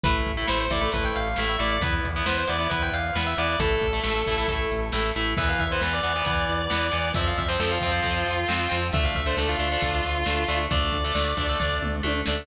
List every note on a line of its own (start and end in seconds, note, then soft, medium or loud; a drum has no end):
0.03 0.23 A1 medium
0.03 0.32 A3 medium
0.03 0.32 E4 medium
0.03 0.14 B4 medium
0.03 kick loud
0.03 closed hi-hat loud
0.26 0.45 A1 medium
0.26 kick medium
0.26 closed hi-hat medium
0.37 0.46 A3 medium
0.37 0.46 E4 medium
0.47 0.68 A1 medium
0.47 0.65 A3 medium
0.47 0.65 E4 medium
0.47 0.59 C5 medium
0.47 snare loud
0.60 0.70 C5 medium
0.70 0.89 A1 medium
0.70 0.79 A3 medium
0.70 0.79 E4 medium
0.70 0.89 D5 medium
0.70 kick medium
0.70 closed hi-hat medium
0.81 0.90 A3 medium
0.81 0.90 E4 medium
0.92 1.12 A1 medium
0.92 1.28 A3 medium
0.92 1.28 E4 medium
0.92 1.04 B4 medium
0.92 kick medium
0.92 closed hi-hat loud
1.04 1.15 G5 medium
1.15 1.35 A1 medium
1.15 1.36 F5 medium
1.15 closed hi-hat medium
1.36 1.57 A1 medium
1.36 1.56 A3 medium
1.36 1.56 E4 medium
1.36 snare loud
1.49 1.59 E5 medium
1.59 1.79 A1 medium
1.59 1.77 A3 medium
1.59 1.77 E4 medium
1.59 1.70 D5 medium
1.59 closed hi-hat medium
1.71 1.82 D5 medium
1.81 2.00 E2 medium
1.81 2.08 B3 medium
1.81 2.08 E4 medium
1.81 1.92 B4 loud
1.81 kick loud
1.81 closed hi-hat loud
2.04 2.23 E2 medium
2.04 kick medium
2.04 closed hi-hat medium
2.16 2.25 B3 medium
2.16 2.25 E4 medium
2.26 2.45 E2 medium
2.26 2.44 B3 medium
2.26 2.44 E4 medium
2.26 2.36 C5 medium
2.26 snare loud
2.37 2.48 C5 medium
2.47 2.68 E2 medium
2.47 2.56 B3 medium
2.47 2.56 E4 medium
2.47 2.67 D5 medium
2.47 closed hi-hat medium
2.58 2.67 B3 medium
2.58 2.67 E4 medium
2.70 2.90 E2 medium
2.70 3.05 B3 medium
2.70 3.05 E4 medium
2.70 2.82 B4 medium
2.70 kick medium
2.70 closed hi-hat loud
2.82 2.92 G5 medium
2.92 3.11 E2 medium
2.92 3.11 F5 medium
2.92 closed hi-hat medium
3.15 3.35 E2 medium
3.15 3.33 B3 medium
3.15 3.33 E4 medium
3.15 snare loud
3.26 3.37 E5 medium
3.37 3.56 E2 medium
3.37 3.56 B3 medium
3.37 3.56 E4 medium
3.37 3.48 D5 medium
3.37 closed hi-hat medium
3.49 3.59 D5 medium
3.59 3.78 A1 medium
3.59 3.86 A3 medium
3.59 3.86 E4 medium
3.59 4.51 A4 loud
3.59 kick loud
3.59 closed hi-hat loud
3.81 4.00 A1 medium
3.81 kick medium
3.81 closed hi-hat medium
3.93 4.02 A3 medium
3.93 4.02 E4 medium
4.04 4.24 A1 medium
4.04 4.21 A3 medium
4.04 4.21 E4 medium
4.04 snare loud
4.26 4.46 A1 medium
4.26 4.36 A3 medium
4.26 4.36 E4 medium
4.26 kick medium
4.26 closed hi-hat medium
4.38 4.47 A3 medium
4.38 4.47 E4 medium
4.48 4.67 A1 medium
4.48 4.85 A3 medium
4.48 4.85 E4 medium
4.48 kick medium
4.48 closed hi-hat loud
4.71 4.91 A1 medium
4.71 closed hi-hat medium
4.92 5.12 A1 medium
4.92 5.11 A3 medium
4.92 5.11 E4 medium
4.92 snare loud
5.15 5.35 A1 medium
5.15 5.34 A3 medium
5.15 5.34 E4 medium
5.15 closed hi-hat medium
5.37 5.56 E2 medium
5.37 5.64 E3 medium
5.37 5.64 B3 medium
5.37 5.48 E5 loud
5.37 kick loud
5.37 crash loud
5.49 5.59 F5 medium
5.59 5.79 E2 medium
5.59 5.70 E5 medium
5.59 kick medium
5.59 closed hi-hat medium
5.71 5.81 E3 medium
5.71 5.81 B3 medium
5.71 5.82 C5 medium
5.81 6.00 E2 medium
5.81 6.00 E3 medium
5.81 6.00 B3 medium
5.81 5.92 B4 medium
5.81 snare loud
5.93 7.10 D5 medium
6.03 6.22 E2 medium
6.03 6.12 E3 medium
6.03 6.12 B3 medium
6.03 closed hi-hat medium
6.16 6.24 E3 medium
6.16 6.24 B3 medium
6.25 6.45 E2 medium
6.25 6.62 E3 medium
6.25 6.62 B3 medium
6.25 kick loud
6.25 closed hi-hat loud
6.49 6.68 E2 medium
6.49 closed hi-hat medium
6.70 6.91 E2 medium
6.70 6.88 E3 medium
6.70 6.88 B3 medium
6.70 snare loud
6.91 7.12 E2 medium
6.91 7.09 E3 medium
6.91 7.09 B3 medium
6.91 closed hi-hat medium
7.14 7.33 F2 medium
7.14 7.43 F3 medium
7.14 7.43 C4 medium
7.14 7.26 E5 loud
7.14 kick loud
7.14 closed hi-hat loud
7.27 7.37 F5 medium
7.37 7.57 F2 medium
7.37 7.48 E5 medium
7.37 kick medium
7.37 closed hi-hat medium
7.48 7.57 F3 medium
7.48 7.57 C4 medium
7.48 7.59 C5 medium
7.59 7.79 F2 medium
7.59 7.78 F3 medium
7.59 7.78 C4 medium
7.59 7.70 A4 medium
7.59 snare loud
7.71 8.75 F4 medium
7.81 8.01 F2 medium
7.81 7.91 F3 medium
7.81 7.91 C4 medium
7.81 kick medium
7.81 closed hi-hat medium
7.91 8.00 F3 medium
7.91 8.00 C4 medium
8.02 8.24 F2 medium
8.02 8.38 F3 medium
8.02 8.38 C4 medium
8.02 kick medium
8.02 closed hi-hat medium
8.26 8.45 F2 medium
8.26 closed hi-hat medium
8.48 8.68 F2 medium
8.48 8.66 F3 medium
8.48 8.66 C4 medium
8.48 snare loud
8.69 8.91 F2 medium
8.69 8.87 F3 medium
8.69 8.87 C4 medium
8.69 closed hi-hat medium
8.93 9.12 D2 medium
8.93 9.21 A3 medium
8.93 9.21 D4 medium
8.93 9.04 E5 loud
8.93 kick loud
8.93 closed hi-hat loud
9.04 9.15 F5 medium
9.15 9.35 D2 medium
9.15 9.25 E5 medium
9.15 kick medium
9.15 closed hi-hat medium
9.26 9.35 A3 medium
9.26 9.35 D4 medium
9.26 9.37 C5 medium
9.37 9.55 D2 medium
9.37 9.56 A3 medium
9.37 9.56 D4 medium
9.37 9.48 A4 medium
9.37 snare loud
9.48 10.58 F4 loud
9.59 9.77 D2 medium
9.59 9.68 A3 medium
9.59 9.68 D4 medium
9.59 closed hi-hat medium
9.72 9.80 A3 medium
9.72 9.80 D4 medium
9.81 10.01 D2 medium
9.81 10.17 A3 medium
9.81 10.17 D4 medium
9.81 kick medium
9.81 closed hi-hat loud
10.04 10.24 D2 medium
10.04 closed hi-hat medium
10.26 10.45 D2 medium
10.26 10.43 A3 medium
10.26 10.43 D4 medium
10.26 snare loud
10.48 10.67 D2 medium
10.48 10.66 A3 medium
10.48 10.66 D4 medium
10.48 closed hi-hat medium
10.71 10.90 D2 medium
10.71 10.97 A3 medium
10.71 10.97 D4 medium
10.71 11.77 D5 medium
10.71 kick loud
10.71 closed hi-hat loud
10.92 11.12 D2 medium
10.92 kick medium
10.92 closed hi-hat medium
11.04 11.13 A3 medium
11.04 11.13 D4 medium
11.15 11.34 D2 medium
11.15 11.33 A3 medium
11.15 11.33 D4 medium
11.15 snare loud
11.36 11.56 D2 medium
11.36 11.46 A3 medium
11.36 11.46 D4 medium
11.36 kick medium
11.36 closed hi-hat medium
11.49 11.58 A3 medium
11.49 11.58 D4 medium
11.60 11.79 D2 medium
11.60 11.95 A3 medium
11.60 11.95 D4 medium
11.60 kick medium
11.60 floor tom medium
11.82 12.01 D2 medium
11.82 mid tom medium
12.03 12.23 D2 medium
12.03 12.21 A3 medium
12.03 12.21 D4 medium
12.03 high tom medium
12.26 12.46 D2 medium
12.26 12.45 A3 medium
12.26 12.45 D4 medium
12.26 snare loud